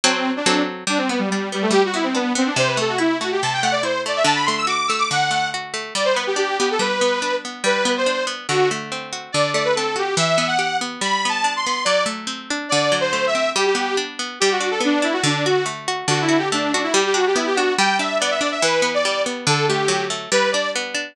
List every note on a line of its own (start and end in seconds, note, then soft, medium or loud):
0.04 0.42 F#3 medium
0.04 0.42 C4 loud
0.04 0.31 C4 medium
0.04 0.42 A4 loud
0.36 0.62 D4 medium
0.46 0.84 F#3 medium
0.46 0.84 C4 medium
0.46 0.84 A4 medium
0.87 1.70 G3 medium
0.87 0.99 D4 medium
0.98 1.08 C4 medium
1.09 1.19 B3 medium
1.09 1.52 B3 medium
1.19 1.29 G3 medium
1.30 1.49 G3 medium
1.30 2.14 D4 medium
1.52 1.63 G3 medium
1.52 1.93 B3 medium
1.62 1.72 A3 medium
1.71 2.51 G3 medium
1.71 1.82 G4 loud
1.85 1.95 F#4 medium
1.94 2.35 B3 medium
1.94 2.04 E4 medium
2.04 2.14 C4 medium
2.15 2.32 B3 medium
2.15 2.55 D4 medium
2.35 2.55 B3 medium
2.35 2.47 C4 medium
2.46 2.57 D4 medium
2.56 3.42 C3 medium
2.56 2.68 C5 medium
2.67 2.77 B4 medium
2.77 3.20 A3 medium
2.77 2.90 A4 medium
2.89 2.99 F#4 medium
2.98 3.83 E4 medium
2.98 3.17 E4 medium
3.20 3.62 A3 medium
3.20 3.30 F#4 medium
3.32 3.42 G4 medium
3.42 4.23 C3 medium
3.42 3.52 A5 medium
3.53 3.63 G5 medium
3.62 4.05 A3 medium
3.62 3.72 F#5 medium
3.72 3.82 D5 medium
3.83 4.23 E4 medium
3.83 4.01 C5 medium
4.06 4.26 A3 medium
4.06 4.17 D5 medium
4.16 4.26 E5 medium
4.24 5.10 D3 medium
4.24 4.36 A5 medium
4.35 4.45 B5 medium
4.46 4.89 A3 medium
4.46 4.56 C6 medium
4.57 4.68 E6 medium
4.67 5.53 F#4 medium
4.67 4.87 D6 medium
4.88 5.30 A3 medium
4.88 4.98 E6 medium
4.98 5.08 D6 medium
5.11 5.91 D3 medium
5.11 5.48 F#5 medium
5.31 5.73 A3 medium
5.54 5.94 F#4 medium
5.74 5.94 A3 medium
5.95 6.79 G3 medium
5.95 6.05 D5 medium
6.05 6.15 C5 medium
6.14 6.59 B3 medium
6.14 6.24 B4 medium
6.27 6.37 G4 medium
6.36 7.22 D4 medium
6.36 6.57 G4 medium
6.59 7.01 B3 medium
6.59 6.69 G4 medium
6.71 6.81 A4 medium
6.79 7.60 G3 medium
6.79 7.35 B4 medium
7.01 7.44 B3 medium
7.22 7.62 D4 medium
7.45 7.65 B3 medium
7.64 8.44 G3 medium
7.64 7.91 B4 medium
7.85 8.26 B3 medium
7.97 8.24 C5 medium
8.06 8.46 D4 medium
8.27 8.47 B3 medium
8.49 9.29 D3 medium
8.49 8.69 F#4 medium
8.71 9.31 A3 medium
8.92 9.32 C4 medium
9.13 9.33 F#4 medium
9.32 10.15 D3 medium
9.32 9.50 D5 medium
9.53 10.14 A3 medium
9.53 9.63 D5 medium
9.64 9.74 B4 medium
9.76 10.17 C4 medium
9.76 9.95 A4 medium
9.96 10.16 F#4 medium
9.96 10.15 G4 medium
10.17 10.97 E3 medium
10.17 10.47 E5 medium
10.38 10.81 B3 medium
10.47 10.77 F#5 medium
10.59 10.99 G4 medium
10.81 11.01 B3 medium
11.01 11.82 G3 medium
11.01 11.26 B5 medium
11.25 11.66 B3 medium
11.25 11.53 A5 medium
11.44 11.84 D4 medium
11.56 11.83 C6 medium
11.66 11.87 B3 medium
11.85 12.66 F#3 medium
11.85 12.03 D5 loud
12.06 12.66 A3 medium
12.27 12.67 C4 medium
12.50 12.71 D4 medium
12.69 13.52 D3 medium
12.69 12.96 D5 medium
12.92 13.52 F#3 medium
13.01 13.25 C5 medium
13.13 13.53 A3 medium
13.27 13.50 E5 medium
13.35 13.55 C4 medium
13.56 14.36 G3 loud
13.56 13.66 G4 medium
13.66 13.96 G4 medium
13.75 14.19 B3 medium
13.97 14.37 D4 medium
14.19 14.39 B3 medium
14.40 15.22 G3 loud
14.40 14.50 G4 medium
14.51 14.70 F#4 medium
14.60 15.02 D4 medium
14.71 14.81 A4 medium
14.80 15.21 B3 medium
14.85 15.05 D4 medium
15.02 15.22 D4 medium
15.02 15.13 E4 medium
15.13 15.23 F#4 medium
15.24 16.04 D3 medium
15.24 15.44 D4 medium
15.45 15.65 F#4 medium
15.45 15.87 F#4 medium
15.66 16.06 A3 medium
15.88 16.08 F#4 medium
16.08 16.88 D3 loud
16.08 16.20 F#4 medium
16.21 16.38 E4 medium
16.29 16.74 F#4 medium
16.38 16.49 G4 medium
16.52 16.92 A3 medium
16.52 16.72 D4 medium
16.72 16.82 D4 medium
16.72 16.94 F#4 medium
16.83 16.93 E4 medium
16.93 17.74 G3 loud
16.93 17.04 G4 medium
17.06 17.16 G4 medium
17.14 17.57 D4 medium
17.14 17.26 F#4 medium
17.27 17.37 G4 medium
17.36 17.76 B3 medium
17.36 17.46 E4 medium
17.46 17.56 G4 medium
17.55 17.78 D4 medium
17.55 17.73 F#4 medium
17.78 18.59 G3 loud
17.78 17.96 G5 medium
17.99 18.40 D4 medium
17.99 18.17 E5 medium
18.20 18.62 B3 medium
18.20 18.30 D5 medium
18.31 18.41 E5 medium
18.40 18.61 D4 medium
18.40 18.50 D5 medium
18.51 18.61 E5 medium
18.62 19.43 E3 medium
18.62 18.90 B4 medium
18.82 19.26 B3 medium
18.94 19.22 D5 medium
19.05 19.45 G3 medium
19.26 19.46 B3 medium
19.47 20.27 D3 loud
19.47 19.66 A4 medium
19.68 20.10 A3 medium
19.68 20.04 G4 medium
19.88 20.28 F#3 medium
20.10 20.30 A3 medium
20.32 21.12 G3 loud
20.32 20.49 B4 loud
20.51 20.94 D4 medium
20.51 20.70 D5 medium
20.76 21.16 B3 medium
20.95 21.15 D4 medium